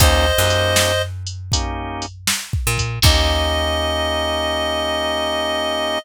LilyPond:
<<
  \new Staff \with { instrumentName = "Clarinet" } { \time 4/4 \key ees \major \tempo 4 = 79 <c'' ees''>4. r2 r8 | ees''1 | }
  \new Staff \with { instrumentName = "Drawbar Organ" } { \time 4/4 \key ees \major <bes des' ees' g'>8 <bes des' ees' g'>4. <bes des' ees' g'>2 | <bes des' ees' g'>1 | }
  \new Staff \with { instrumentName = "Electric Bass (finger)" } { \clef bass \time 4/4 \key ees \major ees,8 ges,2. bes,8 | ees,1 | }
  \new DrumStaff \with { instrumentName = "Drums" } \drummode { \time 4/4 \tuplet 3/2 { <hh bd>8 r8 hh8 sn8 r8 hh8 <hh bd>8 r8 hh8 sn8 bd8 <hh bd>8 } | <cymc bd>4 r4 r4 r4 | }
>>